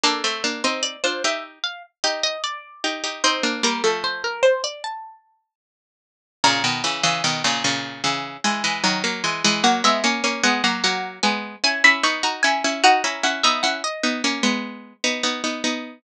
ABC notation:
X:1
M:4/4
L:1/16
Q:1/4=75
K:Bb
V:1 name="Harpsichord"
A z2 c d c =e z f z _e e d4 | c2 B A c B c d a4 z4 | [K:B] a16 | f e g2 f f f2 g2 g b c' a g2 |
f a f e f d7 z4 |]
V:2 name="Harpsichord"
[B,D] [A,C] [B,D] [CE]2 [DF] [EG]2 z2 [EG]2 z2 [EG] [EG] | [CE] [B,D] [G,B,] [F,A,]9 z4 | [K:B] [A,,C,] [B,,D,] [C,E,] [C,E,] [B,,D,] [A,,C,] [A,,C,]2 [C,E,]2 [E,G,] [E,G,] [D,F,] [F,A,] [E,G,] [E,G,] | [F,A,] [G,B,] [A,C] [A,C] [G,B,] [F,A,] [F,A,]2 [G,B,]2 [CE] [CE] [B,D] [DF] [CE] [CE] |
[DF] [CE] [CE] [B,D] [CE] z [B,D] [A,C] [G,B,]3 [B,D] [B,D] [B,D] [B,D]2 |]